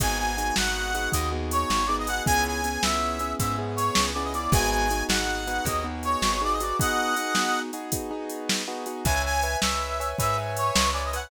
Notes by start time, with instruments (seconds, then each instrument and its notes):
0.00 electric bass (finger) G#1, acoustic grand piano B3 D#4 F#4 G#4, brass section G#5, kick, closed hi-hat
0.18 brass section G#5
0.37 acoustic grand piano B3 D#4 F#4 G#4, closed hi-hat
0.56 electric bass (finger) G#1, acoustic grand piano B3 D#4 F#4 G#4, brass section F#5, snare
0.94 acoustic grand piano B3 D#4 F#4 G#4, closed hi-hat
1.12 electric bass (finger) D#2, acoustic grand piano B3 D#4 F#4 G#4, brass section D#5, kick, closed hi-hat
1.32 acoustic grand piano B3 D#4 F#4 G#4
1.51 brass section C#5, closed hi-hat
1.70 electric bass (finger) G#1, snare
1.87 acoustic grand piano B3 D#4 F#4 G#4, brass section D5
1.99 brass section D#5
2.07 acoustic grand piano B3 D#4 F#4 G#4, brass section F#5, closed hi-hat
2.26 electric bass (finger) C#2, acoustic grand piano B3 C#4 E4 G#4, brass section G#5, kick, closed hi-hat
2.47 brass section G#5
2.64 acoustic grand piano B3 C#4 E4 G#4, closed hi-hat
2.83 electric bass (finger) C#2, acoustic grand piano B3 C#4 E4 G#4, brass section E5, snare
3.19 acoustic grand piano B3 C#4 E4 G#4, closed hi-hat
3.39 electric bass (finger) G#2, acoustic grand piano B3 C#4 E4 G#4, brass section E5, kick, closed hi-hat
3.59 acoustic grand piano B3 C#4 E4 G#4
3.76 brass section C#5, closed hi-hat
3.95 electric bass (finger) C#2, snare
4.14 acoustic grand piano B3 C#4 E4 G#4, brass section D5
4.24 brass section D#5
4.34 acoustic grand piano B3 C#4 E4 G#4, brass section D5, closed hi-hat
4.52 electric bass (finger) G#1, acoustic grand piano B3 D#4 F#4 G#4, brass section G#5, kick, closed hi-hat
4.71 brass section G#5
4.91 acoustic grand piano B3 D#4 F#4 G#4, closed hi-hat
5.09 electric bass (finger) G#1, acoustic grand piano B3 D#4 F#4 G#4, brass section F#5, snare
5.47 acoustic grand piano B3 D#4 F#4 G#4, closed hi-hat
5.65 electric bass (finger) D#2, acoustic grand piano B3 D#4 F#4 G#4, brass section D#5, kick, closed hi-hat
5.84 acoustic grand piano B3 D#4 F#4 G#4
6.03 brass section C#5, closed hi-hat
6.22 electric bass (finger) G#1, snare
6.41 acoustic grand piano B3 D#4 F#4 G#4, brass section D5
6.53 brass section D#5
6.60 acoustic grand piano B3 D#4 F#4 G#4, brass section D5, closed hi-hat
6.79 acoustic grand piano B3 D#4 F#4 G#4, brass section D#5 F#5, kick, closed hi-hat
7.17 acoustic grand piano B3 D#4 F#4 G#4, closed hi-hat
7.35 acoustic grand piano B3 D#4 F#4 G#4, snare
7.73 acoustic grand piano B3 D#4 F#4 G#4, closed hi-hat
7.92 acoustic grand piano B3 D#4 F#4 G#4, kick, closed hi-hat
8.11 acoustic grand piano B3 D#4 F#4 G#4
8.30 closed hi-hat
8.49 snare
8.68 acoustic grand piano B3 D#4 F#4 G#4
8.86 acoustic grand piano B3 D#4 F#4 G#4, closed hi-hat
9.05 electric bass (finger) C#2, acoustic grand piano B4 C#5 E5 G#5, brass section G#5, kick, closed hi-hat
9.25 brass section G#5
9.43 acoustic grand piano B4 C#5 E5 G#5, closed hi-hat
9.62 electric bass (finger) C#2, acoustic grand piano B4 C#5 E5 G#5, brass section E5, snare
10.00 acoustic grand piano B4 C#5 E5 G#5, closed hi-hat
10.18 electric bass (finger) G#2, acoustic grand piano B4 C#5 E5 G#5, brass section E5, kick, closed hi-hat
10.38 acoustic grand piano B4 C#5 E5 G#5
10.57 brass section C#5, closed hi-hat
10.76 electric bass (finger) C#2, snare
10.93 acoustic grand piano B4 C#5 E5 G#5, brass section D5
11.05 brass section D#5
11.13 acoustic grand piano B4 C#5 E5 G#5, brass section F#5, closed hi-hat